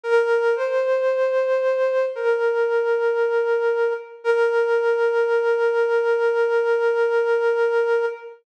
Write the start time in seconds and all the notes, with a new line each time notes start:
0.04 A#4
0.55 C5
2.16 A#4
4.24 A#4